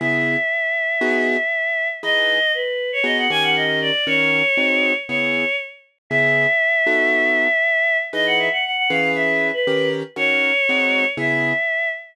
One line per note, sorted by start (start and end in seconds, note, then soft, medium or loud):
0.00 0.36 C#3 loud
0.00 0.36 B3 loud
0.00 0.36 E4 loud
0.00 0.36 G#4 loud
0.00 1.88 E5 medium
1.01 1.37 B3 loud
1.01 1.37 D#4 loud
1.01 1.37 F#4 loud
1.01 1.37 G#4 loud
2.03 2.39 E3 loud
2.03 2.39 D#4 loud
2.03 2.39 G#4 loud
2.03 2.39 B4 loud
2.03 2.52 D#5 medium
2.54 2.91 B4 medium
2.92 3.05 C#5 medium
3.04 3.28 B3 loud
3.04 3.28 D#4 loud
3.04 3.28 F#4 loud
3.04 3.28 G#4 loud
3.04 3.17 D#5 medium
3.18 3.30 F#5 medium
3.30 3.91 D#3 loud
3.30 3.91 C#4 loud
3.30 3.91 G4 loud
3.30 3.91 A#4 loud
3.30 3.43 G#5 medium
3.43 3.55 F#5 medium
3.56 3.79 D#5 medium
3.82 4.05 D5 medium
4.07 4.42 D#3 loud
4.07 4.42 C#4 loud
4.07 4.42 F#4 loud
4.07 4.42 A#4 loud
4.07 4.93 C#5 medium
4.57 4.93 G#3 loud
4.57 4.93 C4 loud
4.57 4.93 D#4 loud
4.57 4.93 F#4 loud
5.08 5.45 C#3 loud
5.08 5.45 B3 loud
5.08 5.45 E4 loud
5.08 5.45 G#4 loud
5.08 5.56 C#5 medium
6.10 6.47 C#3 loud
6.10 6.47 B3 loud
6.10 6.47 E4 loud
6.10 6.47 G#4 loud
6.10 7.97 E5 medium
6.87 7.48 B3 loud
6.87 7.48 D#4 loud
6.87 7.48 F#4 loud
6.87 7.48 A4 loud
8.13 8.49 E3 loud
8.13 8.49 D#4 loud
8.13 8.49 G#4 loud
8.13 8.49 B4 loud
8.13 8.26 D#5 medium
8.27 8.39 F#5 medium
8.39 8.51 E5 medium
8.52 8.64 F#5 medium
8.65 8.76 F#5 medium
8.77 8.89 F#5 medium
8.90 9.51 E3 loud
8.90 9.51 C#4 loud
8.90 9.51 G#4 loud
8.90 9.51 B4 loud
8.90 9.11 F5 medium
9.15 9.48 E5 medium
9.53 9.89 B4 medium
9.67 10.03 D#3 loud
9.67 10.03 C#4 loud
9.67 10.03 G4 loud
9.67 10.03 A#4 loud
10.16 10.52 D#3 loud
10.16 10.52 C#4 loud
10.16 10.52 F#4 loud
10.16 10.52 A#4 loud
10.16 11.06 C#5 medium
10.69 11.05 G#3 loud
10.69 11.05 C4 loud
10.69 11.05 D#4 loud
10.69 11.05 F#4 loud
11.17 11.53 C#3 loud
11.17 11.53 B3 loud
11.17 11.53 E4 loud
11.17 11.53 G#4 loud
11.17 11.89 E5 medium